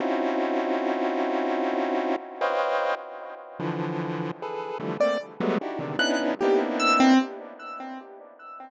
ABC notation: X:1
M:9/8
L:1/16
Q:3/8=50
K:none
V:1 name="Lead 1 (square)"
[C^C^DEF^F]12 [B=c^c^d=fg]3 z3 | [D,E,F,]4 [^GAB]2 [D,E,F,=G,A,] [A,^A,C] z [^F,G,^G,=A,B,] [D^DE^F=G] [C,=D,^D,] [B,^C=D^DE]2 [^A,B,=C=D^DE]4 |]
V:2 name="Acoustic Grand Piano"
z18 | z7 d z4 ^f' z G z e' C |]